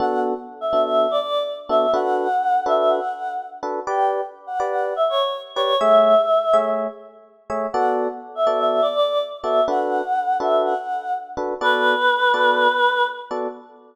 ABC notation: X:1
M:4/4
L:1/16
Q:1/4=124
K:Bm
V:1 name="Choir Aahs"
f2 z3 e2 e2 d d2 z2 e2 | f6 e2 f4 z4 | g2 z3 f2 f2 e c2 z2 c2 | e8 z8 |
f2 z3 e2 e2 d d2 z2 e2 | f6 e2 f4 z4 | B12 z4 |]
V:2 name="Electric Piano 1"
[B,DFA]6 [B,DFA]8 [B,DFA]2 | [DFAB]6 [DFAB]8 [DFAB]2 | [GBd]6 [GBd]8 [GBd]2 | [A,^Gce]6 [A,Gce]8 [A,Gce]2 |
[B,FAd]6 [B,FAd]8 [B,FAd]2 | [DFAB]6 [DFAB]8 [DFAB]2 | [B,FAd]6 [B,FAd]8 [B,FAd]2 |]